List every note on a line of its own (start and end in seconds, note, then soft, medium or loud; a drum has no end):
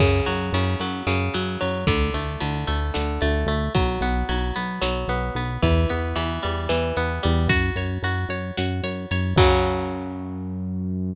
0.00 0.21 F#2 loud
0.00 0.53 C#3 medium
0.00 kick medium
0.00 crash medium
0.26 0.51 F#2 medium
0.26 0.80 F#3 medium
0.26 ride medium
0.53 0.75 F#2 medium
0.53 1.06 C#3 medium
0.53 ride loud
0.80 1.03 F#2 medium
0.80 1.34 F#3 medium
0.80 ride medium
1.07 1.29 F#2 medium
1.07 1.83 C#3 medium
1.07 snare medium
1.34 1.57 F#2 medium
1.34 1.60 F#3 medium
1.34 ride medium
1.61 1.85 F#2 medium
1.61 1.86 F#3 medium
1.61 ride medium
1.87 2.10 D2 medium
1.87 2.40 D3 medium
1.87 kick medium
1.87 ride loud
2.14 2.37 D2 medium
2.14 2.67 A3 medium
2.14 ride medium
2.40 2.65 D2 medium
2.40 2.93 D3 soft
2.40 ride medium
2.67 2.91 D2 medium
2.67 3.21 A3 medium
2.67 ride medium
2.94 3.19 D2 medium
2.94 3.70 D3 medium
2.94 snare medium
3.21 3.45 D2 medium
3.21 3.47 A3 medium
3.21 ride medium
3.46 3.69 D2 medium
3.46 3.73 A3 medium
3.46 ride medium
3.74 3.98 B1 medium
3.74 4.28 F#3 medium
3.74 kick medium
3.74 ride medium
4.01 4.24 B1 medium
4.01 4.55 B3 medium
4.01 ride medium
4.29 4.52 B1 medium
4.29 4.81 F#3 medium
4.29 ride medium
4.55 4.79 B1 medium
4.55 5.09 B3 medium
4.55 ride medium
4.81 5.05 B1 medium
4.81 5.58 F#3 medium
4.81 snare loud
5.08 5.31 B1 medium
5.08 5.36 B3 medium
5.08 ride medium
5.35 5.58 B1 medium
5.35 5.62 B3 medium
5.35 ride medium
5.62 5.86 E2 medium
5.62 6.15 E3 medium
5.62 kick medium
5.62 ride medium
5.89 6.14 E2 medium
5.89 6.97 B3 medium
5.89 ride medium
6.16 6.39 E2 medium
6.16 6.69 E3 medium
6.16 ride loud
6.43 6.68 E2 medium
6.43 7.23 G3 medium
6.43 ride medium
6.69 6.93 E2 medium
6.69 7.45 E3 medium
6.69 snare medium
6.97 7.20 E2 medium
6.97 7.48 B3 medium
6.97 ride medium
7.23 7.48 E2 medium
7.23 7.49 G3 medium
7.23 ride medium
7.48 7.71 F#2 medium
7.48 8.04 F#4 medium
7.48 kick medium
7.48 ride medium
7.76 7.98 F#2 medium
7.76 8.29 C#5 medium
7.76 ride medium
8.02 8.25 F#2 medium
8.02 8.57 F#4 medium
8.02 ride medium
8.29 8.51 F#2 medium
8.29 8.83 C#5 medium
8.29 ride medium
8.57 8.81 F#2 medium
8.57 9.34 F#4 medium
8.57 snare loud
8.83 9.06 F#2 medium
8.83 9.11 C#5 medium
8.83 ride medium
9.11 9.34 F#2 medium
9.11 9.37 C#5 medium
9.11 ride medium
9.36 11.13 F#2 loud
9.36 11.15 C#3 loud
9.36 11.15 F#3 loud
9.36 kick loud
9.36 crash loud